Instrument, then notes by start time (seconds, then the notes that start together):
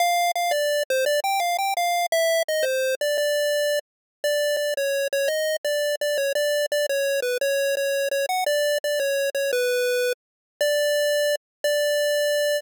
lead 1 (square)
0.00 F5
0.36 F5
0.51 D5
0.90 C5
1.06 D5
1.24 G5
1.40 F5
1.59 G5
1.77 F5
2.12 E5
2.48 D#5
2.63 C5
3.01 D5
3.18 D5
4.24 D5
4.57 D5
4.77 C#5
5.13 C#5
5.28 D#5
5.65 D5
6.01 D5
6.18 C#5
6.35 D5
6.72 D5
6.89 C#5
7.22 B4
7.41 C#5
7.77 C#5
8.11 C#5
8.29 F#5
8.46 D5
8.84 D5
9.00 C#5
9.35 C#5
9.53 B4
10.61 D5
11.64 D5